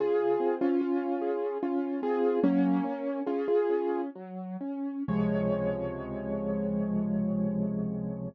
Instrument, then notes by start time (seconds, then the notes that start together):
acoustic grand piano
0.00 C#3 F4 G#4
0.40 C4
0.61 C#4 F4
0.81 F4
1.21 G#4
1.63 C#4 F4
2.02 C4 F4 G#4
2.43 F#3 A#3 C#4
2.84 C#4
3.26 C#4 F4 G#4
3.48 F4 G#4
3.70 C#4
4.15 F#3
4.61 C#4
5.08 C#2 C3 F3 G#3 C#5